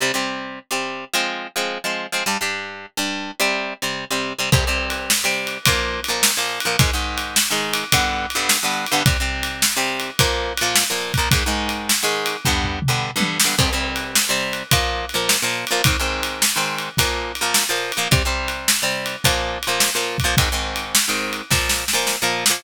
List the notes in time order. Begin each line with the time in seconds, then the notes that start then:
0.00 C3 G3 C4
0.14 C3 G3 C4
0.71 C3 G3 C4
1.13 F3 G#3 C4
1.56 F3 G#3 C4
1.84 F3 G#3 C4
2.12 F3 G#3 C4
2.26 G2 G3 D4
2.41 G2 G3 D4
2.97 G2 G3 D4
3.40 C3 G3 C4
3.82 C3 G3 C4
4.10 C3 G3 C4
4.39 C3 G3 C4
4.52 C3 G3 C4, kick, crash
4.67 C3 G3 C4
4.90 ride
5.10 snare
5.24 C3 G3 C4
5.47 ride
5.65 A#2 F3 A#3, kick, ride
6.04 ride
6.08 A#2 F3 A#3
6.23 snare
6.37 A#2 F3 A#3
6.60 ride
6.65 A#2 F3 A#3
6.79 G#2 D#3 G#3, kick, ride
6.93 G#2 D#3 G#3
7.18 ride
7.36 snare
7.50 G#2 D#3 G#3
7.73 ride
7.92 G2 D3 B3, kick, ride
8.30 ride
8.35 G2 D3 B3
8.49 snare
8.63 G2 D3 B3
8.86 ride
8.92 G2 D3 B3
9.06 C3 G3 C4, kick, ride
9.20 C3 G3 C4
9.43 ride
9.62 snare
9.76 C3 G3 C4
10.00 ride
10.19 A#2 F3 A#3, kick, ride
10.57 A#2, ride
10.62 F3 A#3
10.76 snare
10.90 A#2 F3 A#3
11.14 A#2, kick, ride
11.18 F3 A#3
11.31 G#2 D#3 G#3, kick, ride
11.46 G#2 D#3 G#3
11.69 ride
11.89 snare
12.03 G#2 D#3 G#3
12.26 ride
12.45 G2 D3 B3, kick, floor tom
12.64 floor tom
12.82 mid tom
12.88 G2 D3 B3
13.16 G2 D3 B3
13.20 high tom
13.40 snare
13.44 G2 D3 B3
13.58 C3 G3 C4, kick, crash
13.73 C3 G3 C4
13.96 ride
14.15 snare
14.29 C3 G3 C4
14.53 ride
14.71 A#2 F3 A#3, kick, ride
15.09 ride
15.14 A#2 F3 A#3
15.29 snare
15.42 A#2 F3 A#3
15.67 A#2, ride
15.72 F3 A#3
15.84 G#2 D#3 C4, kick, ride
16.00 G#2 D#3 C4
16.23 ride
16.42 snare
16.56 G#2 D#3 C4
16.78 ride
16.97 A#2 F3 A#3, kick, ride
17.35 ride
17.41 A#2 F3 A#3
17.54 snare
17.69 A#2 F3 A#3
17.92 ride
17.97 A#2 F3 A#3
18.11 C3 G3 C4, kick, ride
18.25 C3 G3 C4
18.48 ride
18.68 snare
18.82 C3 G3 C4
19.06 ride
19.24 A#2 F3 A#3, kick, ride
19.63 ride
19.67 A#2 F3 A#3
19.80 snare
19.95 A#2 F3 A#3
20.18 kick, ride
20.24 A#2 F3 A#3
20.37 G#2 D#3 C4, kick, ride
20.52 G#2 D#3 C4
20.76 ride
20.95 snare
21.08 G#2 D#3 C4
21.33 ride
21.50 A#2 F3 A#3, kick, snare
21.69 snare
21.88 snare
21.93 A#2 F3 A#3
22.07 snare
22.22 A#2 F3 A#3
22.46 A#2, snare
22.50 F3 A#3